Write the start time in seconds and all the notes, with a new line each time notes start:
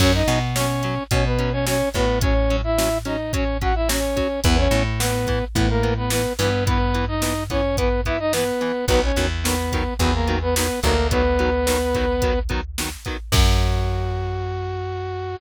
0.00 F#2 F#3 C#4 C#5, kick, crash
0.14 D#4 D#5
0.28 B2 F#3 C#4, closed hi-hat
0.56 F#3 C#4 C#5, snare
0.83 F#3 C#4, closed hi-hat
1.11 B2 F#3 C#4 C#5, kick, closed hi-hat
1.25 B3 B4
1.39 F#3 C#4, closed hi-hat
1.52 C#4 C#5
1.66 F#3 C#4 C#5, snare
1.94 A2 F#3 B3 C#4 B4, kick, closed hi-hat
2.21 F#3 C#4 C#5, kick, closed hi-hat
2.50 F#3 C#4, closed hi-hat
2.64 E4 E5
2.78 F#3 C#4, snare
3.05 F#3 C#4 D#4 D#5, closed hi-hat
3.33 F#3 C#4 C#5, kick, closed hi-hat
3.61 F#3 C#4 F#4 F#5, kick, closed hi-hat
3.75 E4 E5
3.89 F#3 C#4 C#5, snare
4.16 F#3 C#4, kick, closed hi-hat
4.44 E2 E3 B3 B4, kick, closed hi-hat
4.58 C#4 C#5
4.71 A2 E3 B3, closed hi-hat
4.99 E3 B3 B4, snare
5.27 E3 B3, kick, closed hi-hat
5.55 A2 E3 B3 B4, kick, closed hi-hat
5.69 A#3 A#4
5.83 E3 B3, closed hi-hat
5.97 B3 B4
6.10 E3 B3 B4, snare
6.39 G2 E3 B3 B4, open hi-hat
6.66 E3 B3 B4, kick, closed hi-hat
6.94 E3 B3, closed hi-hat
7.08 D#4 D#5
7.22 E3 B3, snare
7.50 E3 B3 C#4 C#5, kick, closed hi-hat
7.77 E3 B3 B4, kick, closed hi-hat
8.05 E3 B3 E4 E5, kick, closed hi-hat
8.19 D#4 D#5
8.33 E3 B3 B4, snare
8.61 E3 B3, closed hi-hat
8.88 B1 D#3 F#3 B3 B4, kick, closed hi-hat
9.03 C#4 C#5
9.16 E2 D#3 F#3 B3, closed hi-hat
9.44 D#3 F#3 B3 B4, snare
9.72 D#3 F#3 B3, kick, closed hi-hat
9.99 E2 D#3 F#3 B3 B4, kick, closed hi-hat
10.14 A#3 A#4
10.28 D#3 F#3 B3, closed hi-hat
10.42 B3 B4
10.55 D#3 F#3 B3 B4, snare
10.83 D2 D#3 F#3 A#3 B3 A#4, kick, closed hi-hat
11.11 D#3 F#3 B3 B4, kick, closed hi-hat
11.39 D#3 F#3 B3, closed hi-hat
11.67 D#3 F#3 B3, snare
11.94 D#3 F#3 B3, kick, closed hi-hat
12.22 D#3 F#3 B3, kick, closed hi-hat
12.49 D#3 F#3 B3, kick, closed hi-hat
12.78 D#3 F#3 B3, snare
13.05 D#3 F#3 B3, kick, closed hi-hat
13.32 F#2 F#3 C#4 F#4, kick, crash